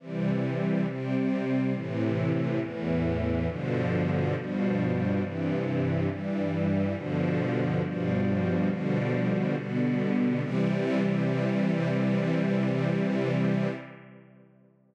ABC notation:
X:1
M:4/4
L:1/8
Q:1/4=69
K:C
V:1 name="String Ensemble 1"
[C,E,G,]2 [C,G,C]2 [A,,C,E,]2 [E,,A,,E,]2 | [G,,B,,D,F,]2 [G,,B,,F,G,]2 [G,,C,E,]2 [G,,E,G,]2 | [G,,B,,D,F,]2 [G,,B,,F,G,]2 [B,,D,F,G,]2 [B,,D,G,B,]2 | [C,E,G,]8 |]